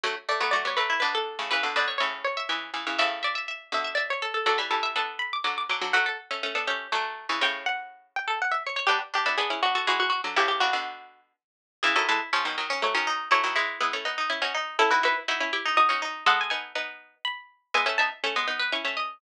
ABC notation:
X:1
M:3/4
L:1/16
Q:1/4=122
K:D
V:1 name="Pizzicato Strings"
z2 d2 d c B2 B A3 | B2 d2 c z c4 z2 | e2 d4 e2 d c A A | A z A2 a2 b d' d' d' d' z |
f12 | g2 f4 g2 f e c c | G z G2 ^G2 F F F F F z | G G F6 z4 |
[K:E] G A A z5 c4 | c12 | A B B z5 d4 | f g g z5 b4 |
g a a z5 c'4 |]
V:2 name="Pizzicato Strings"
A, z A, B, F2 z E D4 | B z B c e2 z e e4 | e z e e e2 z e e4 | d e2 e A4 z4 |
F A z3 A G2 A,3 C | c4 z3 A z3 c | D z D E B2 z A ^G4 | E2 D4 z6 |
[K:E] E E E2 C3 C z C D2 | E E E2 E3 D z C D2 | E E E2 E3 D z C D2 | A6 z6 |
e e e2 e3 B z e d2 |]
V:3 name="Pizzicato Strings"
[D,F,] z2 [F,A,] [F,A,] [G,B,] [F,A,]2 [B,,D,]3 [A,,C,] | [C,E,] [B,,D,] [B,,D,]2 [A,,C,]4 [C,E,]2 [C,E,] [C,E,] | [A,,C,]6 [B,,D,]4 z2 | [D,F,] [E,G,] [E,G,]2 [B,D]4 [D,F,]2 [D,F,] [D,F,] |
[F,A,] z2 [A,C] [A,C] [B,D] [A,C]2 [D,F,]3 [C,E,] | [A,,C,]8 z4 | [G,B,] z2 [B,D] [B,D] [CE] [B,D]2 [E,^G,]3 [D,F,] | [A,,C,]2 [A,,C,] [B,,D,]5 z4 |
[K:E] [C,E,] [D,F,] [E,G,] z [C,^E,] [B,,D,] [D,F,]2 [F,A,] [D,F,]3 | [F,A,] [D,F,] [E,G,]2 [G,B,] [A,C] [B,D]2 [CE] [DF] z2 | [CE] [DF] [DF] z [DF] [CE] [E=G]2 [DF] [DF]3 | [G,B,]2 [B,D]2 [B,D]4 z4 |
[G,B,] [A,C] [B,D] z [A,C] [G,B,] [B,D]2 [CE] [A,C]3 |]